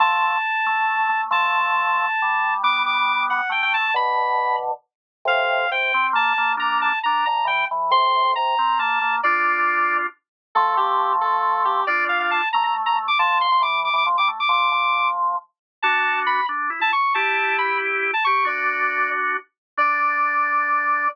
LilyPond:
<<
  \new Staff \with { instrumentName = "Lead 1 (square)" } { \time 6/8 \key d \minor \tempo 4. = 91 a''2. | a''2. | d'''8 d'''4 fis''8 g''16 g''16 a''8 | b''4. r4. |
\key f \major f''4 g''4 a''4 | bes''8 a''8 bes''8 bes''8 g''8 r8 | c'''4 bes''4 a''4 | d''2 r4 |
\key d \minor a'8 g'4 a'4 g'8 | d''8 f''16 f''16 a''8 bes''16 bes''16 r16 bes''16 r16 d'''16 | a''8 c'''16 c'''16 d'''8 d'''16 d'''16 r16 d'''16 r16 d'''16 | d'''4. r4. |
\key d \major a''4 b''8 r8. a''16 cis'''8 | a''4 b''8 r8. a''16 cis'''8 | d''4. r4. | d''2. | }
  \new Staff \with { instrumentName = "Drawbar Organ" } { \time 6/8 \key d \minor <f a>4 r8 a4 a8 | <f a>2 g4 | <g b>2 a4 | <b, d>2 r4 |
\key f \major <a, c>4 c8 c'8 bes8 bes8 | <bes d'>4 d'8 d8 e8 e8 | <a, c>4 c8 c'8 bes8 bes8 | <d' f'>2 r4 |
\key d \minor <f a>2. | <d' f'>4. a4. | f8. f16 e8. e16 f16 g16 a16 r16 | f8 f4. r4 |
\key d \major <d' fis'>4. d'8 e'16 e'16 r8 | <e' g'>2~ <e' g'>8 g'8 | <d' fis'>2~ <d' fis'>8 r8 | d'2. | }
>>